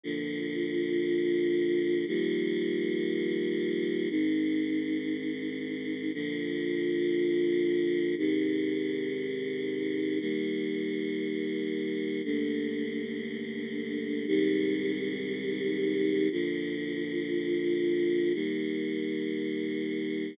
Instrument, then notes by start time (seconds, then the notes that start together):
choir aahs
0.03 A#2 D3 F3
2.07 D#3 F3 G3 A#3
4.10 G#2 D#3 C4
6.13 A#2 D3 F3
8.18 G#2 C3 D#3
10.20 D#3 G3 A#3
12.24 G2 D3 A3 A#3
14.27 G#2 C3 D#3 G3
16.31 A#2 D3 F3
18.34 D#3 G3 A#3